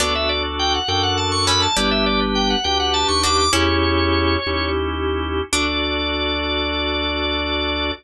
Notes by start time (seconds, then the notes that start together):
0.00 D2 B3 D4 F#4 A4 D5
0.15 E5
0.29 D5
0.59 G5
0.74 F#5
0.88 F#2 D4 F#4 A4 G5
1.03 F#5
1.17 A5
1.32 C#6
1.47 A3 C#4 B5
1.62 A5
1.76 G1 D4 E4 G4 B4 D5
1.91 E5
2.06 D5
2.35 G5
2.50 F#5
2.64 D2 D4 G4 B4 G5
2.80 F#5
2.94 A5
3.08 D#2 C#6
3.23 D4 F#4 D6
3.38 D6
3.53 E2 C#4 E4 G4 C#5
4.46 D#2 C#4 E4 G4
5.53 D2 D4 F#4 A4 D5